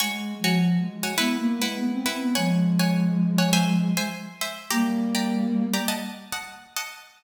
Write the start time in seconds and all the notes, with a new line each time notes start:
0.00 G#3 F#4 C#5 G#5
0.39 F3
0.44 F#4 C#5 G#5
0.78 G#3
1.03 F#4 C#5 G#5
1.18 B3 E4 B4 F#5
1.37 A#3
1.57 G#3
1.62 E4 B4 F#5
1.76 B3
1.91 C4
2.06 E4 B4 F#5
2.21 B3
2.35 F3 G#3 C#5 F#5 G#5
2.79 C#5 F#5 G#5
3.38 C#5 F#5 G#5
3.53 C5 E5 G#5
3.97 C5 E5 G#5
4.41 C5 E5 G#5
4.70 G3 A#3 G4 D5 A#5
5.15 G4 D5 A#5
5.74 G4 D5 A#5
5.88 D#5 F#5 A5
6.32 D#5 F#5 A5
6.76 D#5 F#5 A5